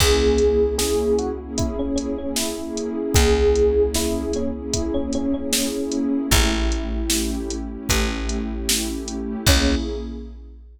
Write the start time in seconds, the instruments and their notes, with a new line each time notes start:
0.00 electric bass (finger) C#2, pad 2 (warm) A#3 C#4 E4 G#4, electric piano 1 G#4, kick, crash
0.22 pad 2 (warm) A#3 C#4 E4 G#4
0.38 pad 2 (warm) A#3 C#4 E4 G#4, closed hi-hat
0.61 pad 2 (warm) A#3 C#4 E4 G#4
0.78 electric piano 1 G#4, snare
1.19 electric piano 1 F#4, closed hi-hat
1.40 pad 2 (warm) A#3 C#4 E4 G#4
1.58 electric piano 1 E4, kick, closed hi-hat
1.79 pad 2 (warm) A#3 C#4 E4 G#4, electric piano 1 C#4
1.96 electric piano 1 C#4, closed hi-hat
2.18 pad 2 (warm) A#3 C#4 E4 G#4, electric piano 1 C#4
2.36 electric piano 1 E4, snare
2.58 pad 2 (warm) A#3 C#4 E4 G#4
2.77 closed hi-hat
3.14 electric bass (finger) C#2, electric piano 1 G#4, kick, closed hi-hat
3.37 pad 2 (warm) A#3 C#4 E4 G#4
3.55 pad 2 (warm) A#3 C#4 E4 G#4, closed hi-hat
3.76 pad 2 (warm) A#3 C#4 E4 G#4
3.94 electric piano 1 E4, snare
4.33 electric piano 1 C#4, closed hi-hat
4.56 pad 2 (warm) A#3 C#4 E4 G#4
4.73 electric piano 1 E4, kick, closed hi-hat
4.94 pad 2 (warm) A#3 C#4 E4 G#4, electric piano 1 C#4
5.13 electric piano 1 C#4, closed hi-hat
5.34 pad 2 (warm) A#3 C#4 E4 G#4, electric piano 1 C#4
5.52 electric piano 1 C#4, snare
5.75 pad 2 (warm) A#3 C#4 E4 G#4
5.92 closed hi-hat
6.31 electric bass (finger) A1, pad 2 (warm) A3 C#4 E4 G4, electric piano 1 E4, kick, closed hi-hat
6.53 pad 2 (warm) A3 C#4 E4 G4
6.72 pad 2 (warm) A3 C#4 E4 G4, closed hi-hat
6.93 pad 2 (warm) A3 C#4 E4 G4
7.10 snare
7.50 closed hi-hat
7.72 pad 2 (warm) A3 C#4 E4 G4
7.89 electric bass (finger) A1, kick, closed hi-hat
8.11 pad 2 (warm) A3 C#4 E4 G4
8.29 closed hi-hat
8.51 pad 2 (warm) A3 C#4 E4 G4
8.69 snare
8.90 pad 2 (warm) A3 C#4 E4 G4
9.08 closed hi-hat
9.47 electric bass (finger) C#2, pad 2 (warm) A#3 C#4 E4 G#4, electric piano 1 C#4, kick, crash